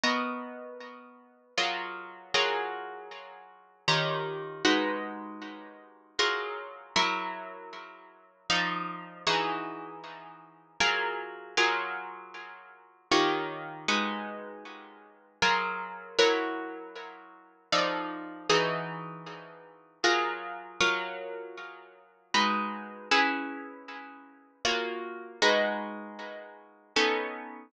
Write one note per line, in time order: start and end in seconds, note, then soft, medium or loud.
0.04 1.54 B3 medium
0.04 1.54 F#4 medium
0.04 1.54 A#4 medium
0.04 1.54 D#5 medium
1.58 2.33 F#3 medium
1.58 2.33 F4 medium
1.58 2.33 G#4 medium
1.58 2.33 A#4 medium
2.34 3.85 F#3 medium
2.34 3.85 F4 medium
2.34 3.85 G#4 medium
2.34 3.85 A#4 medium
3.88 4.63 D#3 medium
3.88 4.63 F4 medium
3.88 4.63 G4 medium
3.88 4.63 C#5 medium
4.65 6.15 G#3 medium
4.65 6.15 D#4 medium
4.65 6.15 F#4 medium
4.65 6.15 B4 medium
6.19 6.94 F#3 medium
6.19 6.94 F4 medium
6.19 6.94 G#4 medium
6.19 6.94 A#4 medium
6.96 8.47 F#3 medium
6.96 8.47 E4 medium
6.96 8.47 A#4 medium
6.96 8.47 C#5 medium
8.50 9.25 F3 medium
8.50 9.25 D#4 medium
8.50 9.25 A4 medium
8.50 9.25 D5 medium
9.27 10.77 E3 medium
9.27 10.77 D#4 medium
9.27 10.77 F#4 medium
9.27 10.77 G#4 medium
10.80 11.56 F#3 medium
10.80 11.56 F4 medium
10.80 11.56 G#4 medium
10.80 11.56 A#4 medium
11.57 13.08 F#3 medium
11.57 13.08 F4 medium
11.57 13.08 G#4 medium
11.57 13.08 A#4 medium
13.12 13.87 D#3 medium
13.12 13.87 F4 medium
13.12 13.87 G4 medium
13.12 13.87 C#5 medium
13.88 15.39 G#3 medium
13.88 15.39 D#4 medium
13.88 15.39 F#4 medium
13.88 15.39 B4 medium
15.42 16.17 F#3 medium
15.42 16.17 F4 medium
15.42 16.17 G#4 medium
15.42 16.17 A#4 medium
16.19 17.69 F#3 medium
16.19 17.69 E4 medium
16.19 17.69 A#4 medium
16.19 17.69 C#5 medium
17.72 18.48 F3 medium
17.72 18.48 D#4 medium
17.72 18.48 A4 medium
17.72 18.48 D5 medium
18.50 20.00 E3 medium
18.50 20.00 D#4 medium
18.50 20.00 F#4 medium
18.50 20.00 G#4 medium
20.04 20.79 F#3 medium
20.04 20.79 F4 medium
20.04 20.79 G#4 medium
20.04 20.79 A#4 medium
20.81 22.31 F#3 medium
20.81 22.31 F4 medium
20.81 22.31 A#4 medium
20.81 22.31 C#5 medium
22.34 23.10 G#3 medium
22.34 23.10 D#4 medium
22.34 23.10 F#4 medium
22.34 23.10 B4 medium
23.11 24.62 C#4 medium
23.11 24.62 E4 medium
23.11 24.62 G#4 medium
23.11 24.62 B4 medium
24.65 25.40 A#3 medium
24.65 25.40 F4 medium
24.65 25.40 F#4 medium
24.65 25.40 C#5 medium
25.42 26.93 G#3 medium
25.42 26.93 D#4 medium
25.42 26.93 F#4 medium
25.42 26.93 B4 medium
26.96 27.72 B3 medium
26.96 27.72 C#4 medium
26.96 27.72 D#4 medium
26.96 27.72 A4 medium